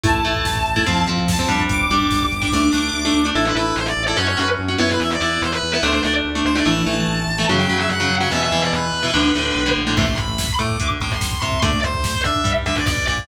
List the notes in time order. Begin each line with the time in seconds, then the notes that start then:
0.04 A1 A3 E4 A5, kick, closed hi-hat
0.14 kick
0.25 A1 A3 E4, kick, closed hi-hat
0.35 kick
0.45 A1, kick, snare
0.56 kick
0.66 A1, kick, closed hi-hat
0.76 A3 E4, kick
0.86 F2 F3 C4, kick, closed hi-hat
0.97 kick
1.07 F2 F3 C4, kick, closed hi-hat
1.18 kick
1.28 F2 A5, kick, snare
1.38 F3 C4, kick
1.49 F2 G3 D4, kick, closed hi-hat
1.59 kick
1.69 G1 D6, kick, closed hi-hat
1.79 kick
1.90 G1 G3 D4, kick, closed hi-hat
2.00 kick
2.11 G1, kick, snare
2.21 kick
2.31 G1, kick, closed hi-hat
2.42 G3 D4, kick
2.52 D2 A3 D4, kick, snare
2.73 D2 A3 D4, snare
2.93 D2
3.05 A3 D4
3.14 D2
3.25 A3 D4
3.35 A1 E4 A4
3.45 B4
3.55 A1 E4 A4 B4
3.76 A1 C5
3.86 D5
3.97 A1
4.06 E4 A4 D5
4.17 F#2 C#4 F#4 C#5
4.28 C#5
4.37 F#2 C#4 F#4 B4
4.59 F#2
4.68 C#4 F#4
4.78 F#2 B3 E4 C#5
4.90 B4
5.00 E2 E5
5.10 D5
5.21 E2 B3 E4 D5
5.42 E2 C5
5.52 B4
5.62 E2
5.73 B3 E4 B4
5.83 D2 A3 D4 C5
5.93 C5
6.04 D2 A3 D4 D5
6.25 D2
6.35 A3 D4
6.45 D2 C5
6.55 A3 D4 D5
6.66 A1 E3 A3 A5
6.86 A1 E3 A3
7.08 A1
7.27 A1
7.38 E3 A3
7.49 F#2 C#3 F#3
7.59 G5
7.69 F#2 C#3 F#3
7.79 E5
7.89 F#2 F#5
8.00 C#3 F#3
8.10 F#2
8.20 C#3 F#3 F#5
8.31 E2 B2 E3 E5
8.42 E5
8.52 E2 B2 E3
8.63 D5
8.73 E2 B4
8.93 E2
9.03 B2 E3
9.14 D2 A2 D3
9.35 D2 A2 D3
9.55 B1
9.66 A2 D3
9.77 A#1
9.87 A2 D3
9.97 A1 C3 E3 A3 C6, kick, crash
10.07 kick
10.17 B5, kick, closed hi-hat
10.28 kick
10.38 kick, snare
10.49 kick
10.59 A2 A3 D6, kick, closed hi-hat
10.69 kick
10.80 D2 D3, kick, closed hi-hat
10.90 kick
11.00 A1 A2 D6, kick, closed hi-hat
11.11 C6, kick
11.21 C6, kick, snare
11.32 kick
11.41 C2 C3 C6, kick, closed hi-hat
11.52 kick
11.62 D2 D3 A3 D5, kick, closed hi-hat
11.73 kick
11.83 C5, kick, closed hi-hat
11.94 kick
12.04 kick, snare
12.14 kick
12.24 D3 D4 E5, kick, closed hi-hat
12.35 kick
12.44 G2 G3, kick, closed hi-hat
12.56 kick
12.66 D2 D3 E5, kick, closed hi-hat
12.76 D5, kick
12.87 B1 B2 D5, kick, snare
12.97 kick
13.07 A#1 A#2 D5, kick, closed hi-hat
13.18 kick